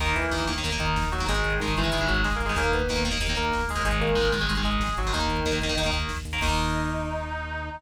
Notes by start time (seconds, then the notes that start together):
0.00 D#2 D#3 A#3 D#4, kick, crash
0.09 kick
0.15 D#2 E3 E4, kick, closed hi-hat
0.24 kick
0.31 D#2 D#3 A#3, kick, snare
0.40 kick
0.47 D#2 D#3 A#3, kick, closed hi-hat
0.56 D#3 A#3, kick
0.64 D#2 D#3 A#3, kick, closed hi-hat
0.72 D#3 A#3, kick
0.79 D#2 D#3 D#4, kick, closed hi-hat
0.88 kick
0.96 D#2, kick, snare
1.04 kick
1.12 D#2 F#3 F#4, kick, closed hi-hat
1.20 D#3 A#3, kick
1.28 G#1 D#3 G#3 G#4, kick, closed hi-hat
1.36 kick
1.44 G#1, kick, closed hi-hat
1.53 kick
1.60 G#1 D#3 G#3 D#4, kick, snare
1.68 kick
1.76 G#1 D#3 E3 G#3 E4, kick, closed hi-hat
1.84 D#3 G#3, kick
1.92 G#1 D#3 G#3, kick, closed hi-hat
2.01 D#3 G#3, kick
2.08 G#1 F#3 F#4, kick, closed hi-hat
2.17 kick
2.24 G#1 G#3 G#4, kick, snare
2.33 A#3 A#4, kick
2.40 G#1, kick, closed hi-hat
2.45 G#3 G#4, kick
2.49 D#3 G#3
2.56 D#2 D#3 A#3 A#4, kick, closed hi-hat
2.66 kick
2.72 D#2 B3 B4, kick, closed hi-hat
2.80 kick
2.89 D#2 D#3 A#3, kick, snare
2.96 kick
3.04 D#2 D#3 A#3, kick, closed hi-hat
3.11 D#3 A#3, kick
3.20 D#2 D#3 A#3, kick, closed hi-hat
3.29 D#3 A#3, kick
3.36 D#2 A#3 A#4, kick, closed hi-hat
3.45 kick
3.52 D#2, kick, snare
3.61 kick
3.68 D#2 G#3 G#4, kick, open hi-hat
3.75 D#3 A#3, kick
3.83 G#1 D#3 G#3 G#4, kick, closed hi-hat
3.93 kick
3.99 G#1 A#3 A#4, kick, closed hi-hat
4.09 kick
4.15 G#1 D#3 G#3, kick, snare
4.25 kick
4.32 G#1 D#3 G#3, kick, closed hi-hat
4.41 D#3 G#3, kick
4.49 G#1 D#3 G#3, kick, closed hi-hat
4.57 D#3 G#3, kick
4.64 G#1 G#3 G#4, kick, closed hi-hat
4.73 kick
4.80 G#1, kick, snare
4.89 kick
4.97 G#1 F#3 F#4, kick, closed hi-hat
5.05 D#3 G#3, kick
5.13 D#2 D#3 A#3 D#4, kick, closed hi-hat
5.21 kick
5.28 D#2, kick, closed hi-hat
5.37 kick
5.45 D#2 D#3 A#3, kick, snare
5.53 kick
5.61 D#2 D#3 A#3, kick, closed hi-hat
5.69 D#3 A#3, kick
5.77 D#2 D#3 A#3, kick, closed hi-hat
5.86 D#3 A#3, kick
5.92 D#2, kick, closed hi-hat
6.02 kick
6.09 D#2, kick, snare
6.17 kick
6.25 D#2, kick, closed hi-hat
6.33 D#3 A#3, kick
6.41 D#2 D#3 A#3 D#4, kick, crash